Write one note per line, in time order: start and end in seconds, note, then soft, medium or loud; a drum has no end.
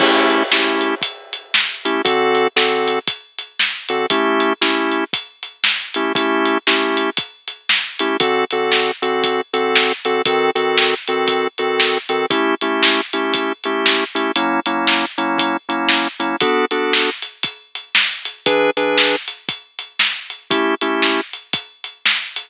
0.00 0.43 A3 medium
0.00 0.43 C#4 medium
0.00 0.43 E4 medium
0.00 0.43 G4 medium
0.00 kick loud
0.00 crash loud
0.30 closed hi-hat medium
0.52 0.95 A3 medium
0.52 0.95 C#4 medium
0.52 0.95 E4 medium
0.52 0.95 G4 medium
0.52 snare loud
0.81 closed hi-hat medium
1.02 kick medium
1.02 closed hi-hat loud
1.33 closed hi-hat medium
1.54 snare loud
1.85 2.02 A3 medium
1.85 2.02 C#4 medium
1.85 2.02 E4 medium
1.85 2.02 G4 medium
1.85 closed hi-hat medium
2.05 2.48 D3 medium
2.05 2.48 C4 medium
2.05 2.48 F#4 medium
2.05 2.48 A4 medium
2.05 kick loud
2.05 closed hi-hat loud
2.35 closed hi-hat medium
2.56 2.99 D3 medium
2.56 2.99 C4 medium
2.56 2.99 F#4 medium
2.56 2.99 A4 medium
2.56 snare loud
2.88 closed hi-hat medium
3.07 kick medium
3.07 closed hi-hat loud
3.38 closed hi-hat medium
3.60 snare loud
3.89 4.06 D3 medium
3.89 4.06 C4 medium
3.89 4.06 F#4 medium
3.89 4.06 A4 medium
3.89 closed hi-hat medium
4.10 4.53 A3 medium
4.10 4.53 C#4 medium
4.10 4.53 E4 medium
4.10 4.53 G4 medium
4.10 kick loud
4.10 closed hi-hat loud
4.40 closed hi-hat medium
4.61 5.04 A3 medium
4.61 5.04 C#4 medium
4.61 5.04 E4 medium
4.61 5.04 G4 medium
4.61 snare loud
4.92 closed hi-hat medium
5.13 kick medium
5.13 closed hi-hat loud
5.43 closed hi-hat medium
5.64 snare loud
5.94 6.13 A3 medium
5.94 6.13 C#4 medium
5.94 6.13 E4 medium
5.94 6.13 G4 medium
5.94 closed hi-hat medium
6.15 6.58 A3 medium
6.15 6.58 C#4 medium
6.15 6.58 E4 medium
6.15 6.58 G4 medium
6.15 kick loud
6.15 closed hi-hat loud
6.45 closed hi-hat medium
6.67 7.10 A3 medium
6.67 7.10 C#4 medium
6.67 7.10 E4 medium
6.67 7.10 G4 medium
6.67 snare loud
6.97 closed hi-hat medium
7.17 kick medium
7.17 closed hi-hat loud
7.48 closed hi-hat medium
7.69 snare loud
7.99 8.17 A3 medium
7.99 8.17 C#4 medium
7.99 8.17 E4 medium
7.99 8.17 G4 medium
7.99 closed hi-hat medium
8.20 8.45 D3 medium
8.20 8.45 C4 medium
8.20 8.45 F#4 medium
8.20 8.45 A4 medium
8.20 kick loud
8.20 closed hi-hat loud
8.51 8.91 D3 medium
8.51 8.91 C4 medium
8.51 8.91 F#4 medium
8.51 8.91 A4 medium
8.51 closed hi-hat medium
8.72 snare loud
9.02 9.41 D3 medium
9.02 9.41 C4 medium
9.02 9.41 F#4 medium
9.02 9.41 A4 soft
9.02 closed hi-hat medium
9.24 kick medium
9.24 closed hi-hat loud
9.53 9.93 D3 medium
9.53 9.93 C4 medium
9.53 9.93 F#4 medium
9.53 9.93 A4 medium
9.53 closed hi-hat medium
9.75 snare loud
10.05 10.22 D3 medium
10.05 10.22 C4 medium
10.05 10.22 F#4 medium
10.05 10.22 A4 medium
10.05 closed hi-hat medium
10.25 10.51 D#3 medium
10.25 10.51 C4 medium
10.25 10.51 F#4 medium
10.25 10.51 A4 medium
10.25 kick loud
10.25 closed hi-hat loud
10.55 10.94 D#3 medium
10.55 10.94 C4 medium
10.55 10.94 F#4 medium
10.55 10.94 A4 medium
10.55 closed hi-hat medium
10.78 snare loud
11.07 11.48 D#3 medium
11.07 11.48 C4 medium
11.07 11.48 F#4 medium
11.07 11.48 A4 medium
11.07 closed hi-hat medium
11.28 kick medium
11.28 closed hi-hat loud
11.58 11.98 D#3 medium
11.58 11.98 C4 medium
11.58 11.98 F#4 medium
11.58 11.98 A4 medium
11.58 closed hi-hat medium
11.80 snare loud
12.09 12.26 D#3 medium
12.09 12.26 C4 medium
12.09 12.26 F#4 medium
12.09 12.26 A4 medium
12.09 closed hi-hat medium
12.30 12.55 A3 medium
12.30 12.55 C#4 medium
12.30 12.55 E4 medium
12.30 12.55 G4 medium
12.30 kick loud
12.30 closed hi-hat loud
12.61 13.01 A3 medium
12.61 13.01 C#4 medium
12.61 13.01 E4 medium
12.61 13.01 G4 medium
12.61 closed hi-hat medium
12.82 snare loud
13.13 13.52 A3 medium
13.13 13.52 C#4 medium
13.13 13.52 E4 medium
13.13 13.52 G4 medium
13.13 closed hi-hat medium
13.34 kick medium
13.34 closed hi-hat loud
13.64 14.04 A3 medium
13.64 14.04 C#4 medium
13.64 14.04 E4 medium
13.64 14.04 G4 medium
13.64 closed hi-hat medium
13.86 snare loud
14.15 14.32 A3 medium
14.15 14.32 C#4 medium
14.15 14.32 E4 medium
14.15 14.32 G4 medium
14.15 closed hi-hat medium
14.36 14.60 F#3 medium
14.36 14.60 A#3 medium
14.36 14.60 C#4 medium
14.36 14.60 E4 medium
14.36 closed hi-hat loud
14.66 15.05 F#3 medium
14.66 15.05 A#3 medium
14.66 15.05 C#4 medium
14.66 15.05 E4 medium
14.66 closed hi-hat medium
14.87 snare loud
15.18 15.57 F#3 medium
15.18 15.57 A#3 medium
15.18 15.57 C#4 medium
15.18 15.57 E4 medium
15.18 closed hi-hat medium
15.38 kick medium
15.38 closed hi-hat loud
15.69 16.08 F#3 medium
15.69 16.08 A#3 medium
15.69 16.08 C#4 medium
15.69 16.08 E4 medium
15.69 closed hi-hat medium
15.89 snare loud
16.19 16.36 F#3 medium
16.19 16.36 A#3 medium
16.19 16.36 C#4 medium
16.19 16.36 E4 medium
16.19 closed hi-hat medium
16.40 16.65 B3 medium
16.40 16.65 D4 medium
16.40 16.65 F#4 medium
16.40 16.65 A4 medium
16.40 kick loud
16.40 closed hi-hat loud
16.71 17.10 B3 medium
16.71 17.10 D4 medium
16.71 17.10 F#4 medium
16.71 17.10 A4 medium
16.71 closed hi-hat medium
16.93 snare loud
17.22 closed hi-hat medium
17.43 kick loud
17.43 closed hi-hat loud
17.75 closed hi-hat medium
17.95 snare loud
18.25 closed hi-hat medium
18.46 18.71 E3 medium
18.46 18.71 D4 medium
18.46 18.71 G#4 medium
18.46 18.71 B4 medium
18.46 kick loud
18.46 closed hi-hat loud
18.77 19.16 E3 medium
18.77 19.16 D4 medium
18.77 19.16 G#4 medium
18.77 19.16 B4 medium
18.77 closed hi-hat medium
18.98 snare loud
19.28 closed hi-hat medium
19.49 kick medium
19.49 closed hi-hat medium
19.79 closed hi-hat medium
19.99 snare loud
20.30 closed hi-hat medium
20.50 20.75 A3 medium
20.50 20.75 C#4 medium
20.50 20.75 E4 medium
20.50 20.75 G4 medium
20.50 kick loud
20.50 closed hi-hat loud
20.81 21.21 A3 medium
20.81 21.21 C#4 medium
20.81 21.21 E4 medium
20.81 21.21 G4 medium
20.81 closed hi-hat medium
21.02 snare loud
21.33 closed hi-hat medium
21.53 kick loud
21.53 closed hi-hat loud
21.84 closed hi-hat medium
22.06 snare loud
22.36 closed hi-hat medium